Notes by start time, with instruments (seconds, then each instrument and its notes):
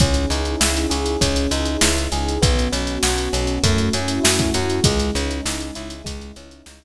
0.00 electric bass (finger) C#2, electric piano 1 C#4, pad 2 (warm) C#4 D#4 E4 G#4, kick, closed hi-hat
0.14 closed hi-hat
0.30 electric bass (finger) C#2, electric piano 1 D#4, closed hi-hat
0.45 closed hi-hat
0.60 electric bass (finger) C#2, electric piano 1 E4, snare
0.76 closed hi-hat
0.90 electric bass (finger) C#2, electric piano 1 G#4, closed hi-hat
1.06 closed hi-hat
1.21 electric bass (finger) C#2, electric piano 1 C#4, pad 2 (warm) C#4 D#4 E4 G#4, kick, closed hi-hat
1.36 closed hi-hat
1.51 electric bass (finger) C#2, electric piano 1 D#4, closed hi-hat
1.66 closed hi-hat
1.81 electric bass (finger) C#2, electric piano 1 E4, snare
1.98 closed hi-hat
2.12 electric bass (finger) C#2, electric piano 1 G#4, closed hi-hat
2.29 closed hi-hat
2.42 electric bass (finger) B1, electric piano 1 B3, pad 2 (warm) B3 C#4 F#4, kick, closed hi-hat
2.59 closed hi-hat
2.72 electric bass (finger) B1, electric piano 1 C#4, closed hi-hat
2.87 closed hi-hat
3.03 electric bass (finger) B1, electric piano 1 F#4, snare
3.18 closed hi-hat
3.33 electric bass (finger) B1, electric piano 1 C#4, closed hi-hat
3.47 closed hi-hat
3.63 electric bass (finger) F#2, electric piano 1 A3, pad 2 (warm) A3 C#4 E4 F#4, kick, closed hi-hat
3.78 closed hi-hat
3.93 electric bass (finger) F#2, electric piano 1 C#4, closed hi-hat
4.08 closed hi-hat
4.23 electric bass (finger) F#2, electric piano 1 E4, snare
4.39 kick, closed hi-hat
4.54 electric bass (finger) F#2, electric piano 1 F#4, closed hi-hat
4.70 closed hi-hat
4.84 electric bass (finger) C#2, electric piano 1 G#3, pad 2 (warm) G#3 C#4 D#4 E4, kick, closed hi-hat
4.99 closed hi-hat
5.15 electric bass (finger) C#2, electric piano 1 C#4, closed hi-hat
5.31 closed hi-hat
5.45 electric bass (finger) C#2, electric piano 1 D#4, snare
5.60 closed hi-hat
5.75 electric bass (finger) C#2, electric piano 1 E4, closed hi-hat
5.90 closed hi-hat
6.04 electric bass (finger) C#2, pad 2 (warm) G#3 C#4 D#4 E4, electric piano 1 G#3, kick, closed hi-hat
6.21 closed hi-hat
6.36 electric bass (finger) C#2, electric piano 1 C#4, closed hi-hat
6.51 closed hi-hat
6.66 electric bass (finger) C#2, electric piano 1 D#4, snare
6.82 closed hi-hat